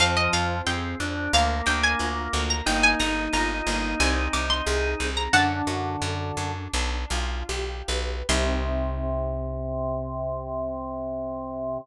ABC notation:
X:1
M:4/4
L:1/16
Q:1/4=90
K:Cm
V:1 name="Harpsichord"
f e f2 g4 f2 g a4 b | g a b2 b4 a2 d' c'4 b | "^rit." [^f=a]8 z8 | c'16 |]
V:2 name="Drawbar Organ"
F,4 C2 D2 B,8 | E16 | "^rit." D,8 z8 | C,16 |]
V:3 name="Orchestral Harp"
C2 F2 A2 C2 B,2 D2 F2 B,2 | B,2 E2 F2 B,2 C2 E2 A2 C2 | "^rit." D2 ^F2 =A2 D2 D2 =F2 G2 =B2 | [CEG]16 |]
V:4 name="Electric Bass (finger)" clef=bass
F,,2 F,,2 F,,2 F,,2 D,,2 D,,2 D,,2 D,,2 | G,,,2 G,,,2 G,,,2 G,,,2 C,,2 C,,2 C,,2 C,,2 | "^rit." ^F,,2 F,,2 F,,2 F,,2 =B,,,2 B,,,2 B,,,2 B,,,2 | C,,16 |]